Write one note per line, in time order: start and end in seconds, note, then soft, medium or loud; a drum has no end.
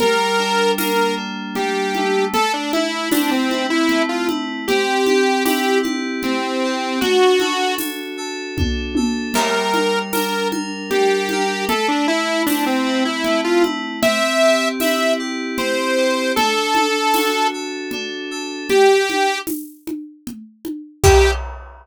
0.00 1.55 G3 loud
0.00 0.72 A#4 medium
0.00 low conga medium
0.39 1.16 D4 loud
0.77 2.25 A#3 medium
0.77 1.15 A#4 medium
0.77 tambourine medium
0.77 high conga medium
1.17 2.28 D4 medium
1.55 2.30 G3 loud
1.55 2.25 G4 medium
1.55 low conga medium
1.95 3.90 A3 loud
1.95 high conga medium
2.34 2.52 A4 medium
2.34 low conga medium
2.54 2.72 D4 medium
2.73 3.09 E4 medium
2.73 3.50 E4 medium
2.73 high conga medium
3.12 4.60 C4 medium
3.12 3.30 D4 medium
3.12 tambourine medium
3.12 high conga medium
3.31 3.66 C4 medium
3.50 4.28 E4 medium
3.50 high conga medium
3.70 4.02 E4 medium
3.89 4.64 A3 medium
3.89 low conga medium
4.09 4.28 F4 medium
4.28 4.65 E4 medium
4.28 high conga medium
4.68 6.22 C4 loud
4.68 5.44 G4 medium
4.68 low conga medium
5.06 5.82 G4 medium
5.06 high conga medium
5.45 6.93 E4 medium
5.45 5.79 G4 medium
5.45 tambourine medium
5.45 high conga medium
5.83 6.64 G4 medium
5.83 high conga medium
6.23 6.97 C4 medium
6.23 7.00 C4 medium
6.23 low conga medium
6.64 7.01 G4 medium
7.01 8.57 D4 medium
7.01 7.75 F#4 medium
7.01 low conga medium
7.39 8.17 A4 medium
7.39 high conga medium
7.78 9.27 F#4 medium
7.78 tambourine medium
7.78 high conga medium
8.17 8.96 A4 medium
8.57 9.32 D4 medium
8.57 kick medium
8.57 high tom medium
8.95 9.33 A4 medium
8.95 high tom medium
9.34 10.91 G3 loud
9.34 9.99 A#4 medium
9.34 crash loud
9.34 low conga medium
9.74 10.51 A#4 medium
9.74 high conga medium
10.13 11.62 D4 medium
10.13 10.48 A#4 medium
10.13 tambourine medium
10.13 high conga medium
10.51 11.31 A#4 medium
10.51 high conga medium
10.91 11.65 G3 medium
10.91 11.65 G4 medium
10.91 low conga medium
11.29 11.69 A#4 medium
11.29 high conga medium
11.68 13.24 A3 loud
11.68 11.88 A4 medium
11.68 low conga medium
11.88 12.07 D4 medium
12.08 12.43 E4 medium
12.08 12.85 E4 medium
12.46 13.95 C4 medium
12.46 12.65 D4 medium
12.46 tambourine medium
12.46 high conga medium
12.66 13.04 C4 medium
12.86 13.62 E4 medium
13.05 13.41 E4 medium
13.24 13.98 A3 loud
13.24 low conga medium
13.44 13.63 F4 medium
13.62 13.99 E4 medium
13.62 high conga medium
14.02 15.57 C4 loud
14.02 14.68 E5 medium
14.02 low conga loud
14.42 15.19 G4 medium
14.80 16.30 E4 medium
14.80 15.14 E5 medium
14.80 tambourine medium
14.80 high conga medium
15.19 15.97 G4 medium
15.57 16.31 C4 loud
15.57 16.32 C5 medium
15.57 low conga medium
15.97 16.34 G4 medium
16.36 17.92 D4 loud
16.36 17.47 A4 medium
16.36 low conga medium
16.75 17.53 A4 medium
16.75 high conga medium
17.14 18.62 F#4 medium
17.14 tambourine medium
17.14 high conga medium
17.54 18.31 A4 medium
17.91 18.66 D4 loud
17.91 low conga medium
18.31 18.68 A4 medium
18.69 19.39 G4 medium
18.69 low conga medium
19.10 high conga medium
19.47 tambourine medium
19.47 high conga medium
19.87 high conga medium
20.27 low conga medium
20.65 high conga medium
21.04 21.31 G4 loud
21.04 kick loud
21.04 crash loud